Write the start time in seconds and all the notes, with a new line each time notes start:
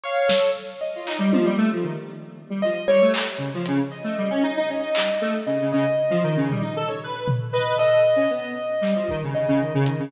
0.04 C#5 F5
0.27 A4, snare
0.81 D#5
0.96 F4
1.07 D#4, clap
1.19 G3
1.33 F3, high tom
1.45 G3
1.58 A3
1.73 F3
1.84 D#3
2.50 G3
2.62 F3 D#5
2.87 G3 C#5
3.02 A3
3.14 clap
3.38 C#3
3.54 F3
3.66 C#3, closed hi-hat
3.91 D#5
4.04 A3
4.18 G3
4.30 C#4
4.43 D#4
4.57 D#4
4.69 C#4 D#5
4.82 D#4
4.95 G3, clap
5.21 A3
5.46 C#3 D#5
5.61 C#3
5.72 C#3 D#5
6.10 F3
6.23 D#3
6.37 C#3
6.50 G3, floor tom
6.62 D#4
6.76 A4
6.88 C#5
7.04 B4
7.28 floor tom
7.53 B4 D#5
7.77 A4 D#5
8.16 C#4
8.30 B3
8.81 G3, clap
8.96 F3
9.09 D#3, kick
9.23 C#3
9.34 C#3 D#5
9.48 C#3
9.60 D#3
9.74 C#3
9.86 D#3, closed hi-hat
10.00 C#3